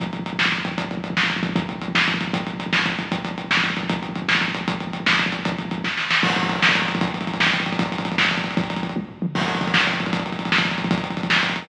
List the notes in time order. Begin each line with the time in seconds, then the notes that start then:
0.00 kick, closed hi-hat
0.06 kick
0.13 kick, closed hi-hat
0.19 kick
0.26 kick, closed hi-hat
0.33 kick
0.39 kick, snare
0.46 kick
0.52 kick, closed hi-hat
0.58 kick
0.65 kick, closed hi-hat
0.71 kick
0.78 kick, closed hi-hat
0.84 kick
0.91 kick, closed hi-hat
0.97 kick
1.04 kick, closed hi-hat
1.10 kick
1.17 kick, snare
1.23 kick
1.30 kick, closed hi-hat
1.36 kick
1.43 kick, closed hi-hat
1.49 kick
1.56 kick, closed hi-hat
1.62 kick
1.69 kick, closed hi-hat
1.75 kick
1.82 kick, closed hi-hat
1.88 kick
1.95 kick, snare
2.01 kick
2.08 kick, closed hi-hat
2.14 kick
2.21 kick, closed hi-hat
2.28 kick
2.33 kick, closed hi-hat
2.40 kick
2.47 kick, closed hi-hat
2.54 kick
2.60 kick, closed hi-hat
2.66 kick
2.73 kick, snare
2.79 kick
2.86 kick, closed hi-hat
2.92 kick
2.99 kick, closed hi-hat
3.05 kick
3.12 kick, closed hi-hat
3.18 kick
3.25 kick, closed hi-hat
3.31 kick
3.38 kick, closed hi-hat
3.44 kick
3.51 kick, snare
3.57 kick
3.64 kick, closed hi-hat
3.70 kick
3.77 kick, closed hi-hat
3.83 kick
3.90 kick, closed hi-hat
3.96 kick
4.02 kick, closed hi-hat
4.09 kick
4.16 kick, closed hi-hat
4.22 kick
4.28 kick, snare
4.35 kick
4.41 kick, closed hi-hat
4.48 kick
4.55 kick, closed hi-hat
4.61 kick
4.68 kick, closed hi-hat
4.74 kick
4.80 kick, closed hi-hat
4.87 kick
4.93 kick, closed hi-hat
5.00 kick
5.06 kick, snare
5.13 kick
5.19 kick, closed hi-hat
5.26 kick
5.32 kick, closed hi-hat
5.39 kick
5.45 kick, closed hi-hat
5.52 kick
5.58 kick, closed hi-hat
5.65 kick
5.71 kick, closed hi-hat
5.78 kick
5.84 kick, snare
5.97 snare
6.11 snare
6.23 kick, crash
6.30 kick, closed hi-hat
6.36 kick, closed hi-hat
6.43 kick, closed hi-hat
6.49 kick, closed hi-hat
6.56 kick, closed hi-hat
6.62 kick, snare
6.69 kick, closed hi-hat
6.75 kick, closed hi-hat
6.82 kick, closed hi-hat
6.88 kick, closed hi-hat
6.95 kick, closed hi-hat
7.01 kick, closed hi-hat
7.07 kick, closed hi-hat
7.14 kick, closed hi-hat
7.21 kick, closed hi-hat
7.27 kick, closed hi-hat
7.34 kick, closed hi-hat
7.40 kick, snare
7.47 kick, closed hi-hat
7.53 kick, closed hi-hat
7.60 kick, closed hi-hat
7.66 kick, closed hi-hat
7.72 kick, closed hi-hat
7.79 kick, closed hi-hat
7.86 kick, closed hi-hat
7.92 kick, closed hi-hat
7.98 kick, closed hi-hat
8.05 kick, closed hi-hat
8.12 kick, closed hi-hat
8.18 kick, snare
8.25 kick, closed hi-hat
8.31 kick, closed hi-hat
8.38 kick, closed hi-hat
8.44 kick, closed hi-hat
8.51 kick, closed hi-hat
8.57 kick, closed hi-hat
8.64 kick, closed hi-hat
8.70 kick, closed hi-hat
8.76 kick, closed hi-hat
8.83 kick, closed hi-hat
8.89 kick, closed hi-hat
8.96 kick, high tom
9.09 floor tom
9.22 mid tom
9.35 kick, crash
9.41 kick, closed hi-hat
9.48 kick, closed hi-hat
9.55 kick, closed hi-hat
9.61 kick, closed hi-hat
9.67 kick, closed hi-hat
9.74 kick, snare
9.80 kick, closed hi-hat
9.87 kick, closed hi-hat
9.93 kick, closed hi-hat
10.00 kick, closed hi-hat
10.06 kick, closed hi-hat
10.13 kick, closed hi-hat
10.19 kick, closed hi-hat
10.26 kick, closed hi-hat
10.32 kick, closed hi-hat
10.39 kick, closed hi-hat
10.45 kick, closed hi-hat
10.52 kick, snare
10.58 kick, closed hi-hat
10.65 kick, closed hi-hat
10.71 kick, closed hi-hat
10.78 kick, closed hi-hat
10.84 kick, closed hi-hat
10.91 kick, closed hi-hat
10.98 kick, closed hi-hat
11.04 kick, closed hi-hat
11.10 kick, closed hi-hat
11.17 kick, closed hi-hat
11.23 kick, closed hi-hat
11.30 kick, snare
11.36 kick, closed hi-hat
11.43 kick, closed hi-hat
11.49 kick, closed hi-hat
11.56 kick, closed hi-hat
11.62 kick, open hi-hat